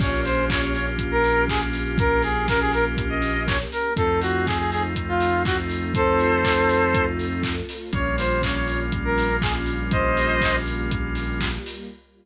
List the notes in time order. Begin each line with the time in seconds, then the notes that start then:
0.00 A#1 A#3 C#4 F4 G4 C#5, kick, crash
0.25 C5, open hi-hat
0.50 C#5, kick, clap
0.62 C#5
0.74 C#5, open hi-hat
0.98 kick, closed hi-hat
1.11 A#4
1.24 open hi-hat
1.48 G#4, kick, clap
1.73 open hi-hat
1.97 A#3 C#4 G4 A#4, kick, closed hi-hat
2.22 G#4, open hi-hat
2.48 A#4, kick, clap
2.60 G#4
2.73 A#4, open hi-hat
2.97 kick, closed hi-hat
3.10 D#5
3.22 open hi-hat
3.47 C#5, kick, clap
3.72 A#4, open hi-hat
3.95 F2 A3 C4 D#4 F4 A4, kick, closed hi-hat
4.21 F#4, open hi-hat
4.46 G#4, kick, clap
4.59 G#4
4.71 G#4, open hi-hat
4.95 kick, closed hi-hat
5.08 F4
5.20 open hi-hat
5.45 F#4, kick, clap
5.70 open hi-hat
5.94 A3 C4 F4 A4 C5, kick, closed hi-hat
6.19 open hi-hat
6.44 kick, clap
6.69 open hi-hat
6.94 kick, closed hi-hat
7.19 open hi-hat
7.43 kick, clap
7.69 open hi-hat
7.92 A#1 G3 A#3 C#4 F4 C#5, kick, closed hi-hat
8.18 C5, open hi-hat
8.42 C#5, kick, clap
8.56 C#5
8.68 C#5, open hi-hat
8.92 kick, closed hi-hat
9.05 A#4
9.18 open hi-hat
9.42 G#4, kick, clap
9.66 open hi-hat
9.91 G3 A#3 F4 G4 C5 D#5, kick, closed hi-hat
10.17 open hi-hat
10.41 kick, clap
10.66 open hi-hat
10.91 kick, closed hi-hat
11.15 open hi-hat
11.40 kick, clap
11.66 open hi-hat